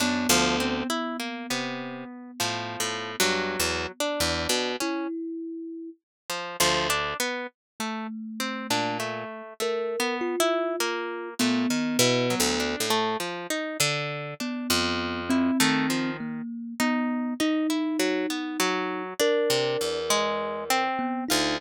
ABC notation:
X:1
M:6/4
L:1/16
Q:1/4=50
K:none
V:1 name="Orchestral Harp" clef=bass
^F,, D,,2 z2 C,2 z (3A,,2 A,,2 G,,2 E,, z E,, B,, z6 D,,2 | z5 ^A,,2 z7 A,, ^D, (3B,,2 =D,,2 =A,,2 z2 =D,2 | z F,,3 ^D,3 z10 C, E,,4 z =D,, |]
V:2 name="Kalimba"
B,16 E4 z4 | z2 A,6 ^A2 F4 B,5 z5 | B,3 C3 ^A,2 B,2 ^D6 ^A6 B, D |]
V:3 name="Orchestral Harp"
D F, C E ^A, B,3 (3F,4 ^F,4 D4 ^C z4 =F, F, D | B, z A, z C D A,2 (3A,2 B,2 E2 ^A,2 =A, z E ^F, D A, =F, ^D =D2 | D z2 E A, F, z2 ^D2 D E ^F, B, F,2 =D3 ^G,2 C2 =F |]